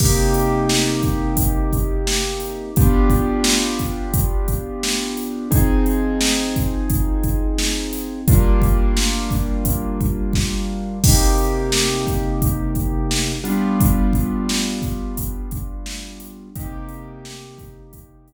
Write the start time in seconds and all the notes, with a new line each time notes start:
0.00 C3 A#3 D#4 G4, kick, crash
0.34 closed hi-hat
0.69 snare
1.03 kick, closed hi-hat
1.37 kick, closed hi-hat
1.73 kick, closed hi-hat
2.07 snare
2.40 closed hi-hat
2.76 B3 D4 F4 G4, kick, closed hi-hat
3.10 kick, closed hi-hat
3.44 snare
3.79 kick, closed hi-hat
4.14 kick, closed hi-hat
4.48 kick, closed hi-hat
4.83 snare
5.17 closed hi-hat
5.51 F3 C4 D#4 G#4, kick, closed hi-hat
5.86 closed hi-hat
6.21 snare
6.56 kick, closed hi-hat
6.90 kick, closed hi-hat
7.23 kick, closed hi-hat
7.58 snare
7.93 snare, closed hi-hat
8.28 G3 A#3 D4 F4, kick, closed hi-hat
8.62 kick, closed hi-hat
8.97 snare
9.31 kick, closed hi-hat
9.65 kick, closed hi-hat
10.01 kick, closed hi-hat
10.33 kick, snare
11.04 C3 A#3 D#4 G4, kick, crash
11.38 closed hi-hat
11.72 snare
12.07 kick, closed hi-hat
12.42 kick, closed hi-hat
12.75 kick, closed hi-hat
13.11 snare
13.44 G3 B3 D4 F4, closed hi-hat
13.80 kick, closed hi-hat
14.13 kick, closed hi-hat
14.49 snare
14.82 kick, closed hi-hat
15.17 kick, closed hi-hat
15.51 kick, closed hi-hat
15.86 snare
16.20 closed hi-hat
16.55 C3 A#3 D#4 G4, kick, closed hi-hat
16.89 closed hi-hat
17.25 snare
17.58 kick, closed hi-hat
17.93 kick, closed hi-hat
18.28 closed hi-hat